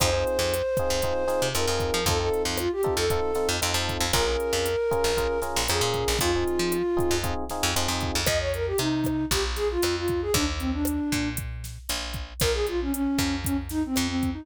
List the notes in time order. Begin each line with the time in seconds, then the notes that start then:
0.00 F2 C4 D#4 F4 G#4 C5, kick, cross-stick, closed hi-hat
0.13 C4 D#4 F4 G#4
0.27 closed hi-hat
0.39 F2
0.54 closed hi-hat
0.77 C4 D#4 F4 G#4, kick, cross-stick, closed hi-hat
0.90 F2
1.02 C4 D#4 F4 G#4, kick, closed hi-hat
1.28 C4 D#4 F4 G#4, snare, closed hi-hat
1.42 C3
1.55 F2 C4 D#4 F4 G#4 A#4, cross-stick, closed hi-hat
1.67 F2 C4 D#4 F4 G#4
1.80 kick, closed hi-hat
1.94 F3
2.06 F2 C4 D#4 F4 A4, kick, closed hi-hat
2.20 C4 D#4 F4 A4
2.34 closed hi-hat
2.45 F2
2.58 F4, cross-stick, closed hi-hat
2.72 G4
2.83 C4 D#4 F4 A4, kick, closed hi-hat
2.97 F2 A4
3.10 C4 D#4 F4 A4, kick, closed hi-hat
3.35 C4 D#4 F4 A4, snare, closed hi-hat
3.49 F2
3.62 F2 C4 D#4 F4 A4, closed hi-hat
3.74 F2 C4 D#4 F4 A4
3.89 kick, closed hi-hat
4.00 F2
4.13 A#1 C#4 F4 G#4 A#4, kick, cross-stick, closed hi-hat
4.27 C#4 F4 G#4 A#4
4.40 closed hi-hat
4.53 F2
4.66 closed hi-hat
4.91 C#4 F4 G#4 A#4, kick, cross-stick, closed hi-hat
5.04 A#1
5.17 C#4 F4 G#4 A#4, kick, closed hi-hat
5.42 C#4 F4 G#4 A#4, snare, closed hi-hat
5.56 A#1
5.68 F2 C#4 F4 G#4 A#4, cross-stick, closed hi-hat
5.81 A#2 C#4 F4 G#4 A#4
5.94 kick, closed hi-hat
6.08 A#1
6.19 F2 C4 D#4 F4 G#4, kick, closed hi-hat
6.35 C4 D#4 F4 G#4
6.48 closed hi-hat
6.59 F3
6.72 cross-stick, closed hi-hat
6.97 C4 D#4 F4 G#4, kick, closed hi-hat
7.11 F2
7.23 C4 D#4 F4 G#4, kick, closed hi-hat
7.50 C4 D#4 F4 G#4, snare, closed hi-hat
7.63 F2
7.76 F2 C4 D#4 F4 G#4, closed hi-hat
7.88 F2 C4 D#4 F4 G#4
8.01 kick, closed hi-hat
8.15 F2
8.26 F2 D#5, kick, cross-stick, closed hi-hat
8.40 C#5
8.54 A#4, closed hi-hat
8.67 G4
8.78 C3 D#4, closed hi-hat
9.04 kick, cross-stick, closed hi-hat
9.31 A#1 G4, kick, closed hi-hat
9.56 G#4, snare, closed hi-hat
9.71 F4
9.82 F2, cross-stick, closed hi-hat
9.97 F4
10.08 kick, closed hi-hat
10.22 G#4
10.34 D#2 D4, kick, closed hi-hat
10.59 C4, closed hi-hat
10.73 D4
10.85 cross-stick, closed hi-hat
11.12 A#2, kick, closed hi-hat
11.37 kick, closed hi-hat
11.64 snare, closed hi-hat
11.89 A#1, closed hi-hat
12.14 kick, closed hi-hat
12.40 A#1 A#4, kick, cross-stick, closed hi-hat
12.54 G#4
12.67 F4, closed hi-hat
12.81 C#4
12.93 C#4, closed hi-hat
13.18 F2, kick, cross-stick, closed hi-hat
13.45 C#4, kick, closed hi-hat
13.69 D#4, snare, closed hi-hat
13.86 C4
13.96 F2, cross-stick, closed hi-hat
14.08 C4
14.23 kick, closed hi-hat
14.33 D#4